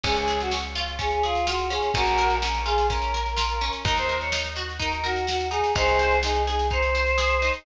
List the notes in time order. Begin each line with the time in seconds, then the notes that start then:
0.03 C#2 C#4 G#4, kick, snare, crash
0.16 G#4, snare
0.28 G#4, snare
0.40 F#4, snare
0.51 C#4, snare
0.63 snare
0.75 F4, snare
0.87 snare
0.99 C#4 G#4, kick, snare
1.11 G#4, snare
1.23 F4 G#4, snare
1.35 snare
1.47 F4 F#4, snare
1.59 snare
1.70 C#4 G#4, snare
1.82 snare
1.94 A#1 C#4 F#4 A#4, kick, snare
2.06 snare
2.18 A#4, snare
2.30 snare
2.41 C#4 A#4, snare
2.54 snare
2.65 F4 G#4, snare
2.78 snare
2.89 C#4 A#4, kick, snare
3.02 snare
3.14 A#4, snare
3.26 snare
3.37 F4, snare
3.49 snare
3.61 C#4, snare
3.73 snare
3.85 D#2 D#4 A#4, kick, snare
3.96 C5, snare
4.09 A#4, snare
4.20 C#5, snare
4.32 D#4, snare
4.44 snare
4.56 F#4, snare
4.69 snare
4.79 D#4 A#4, kick, snare
4.92 A#4, snare
5.04 F#4 A#4, snare
5.16 snare
5.27 F#4, snare
5.40 snare
5.50 D#4 G#4, snare
5.64 snare
5.75 C2 D#4 G#4 C5, kick, snare
5.88 snare
5.99 C5, snare
6.11 snare
6.23 D#4 G#4, snare
6.35 snare
6.46 G#4, snare
6.59 snare
6.70 D#4 C5, kick, snare
6.82 snare
6.95 C5, snare
7.07 snare
7.18 G#4, snare
7.30 snare
7.42 D#4, snare
7.53 snare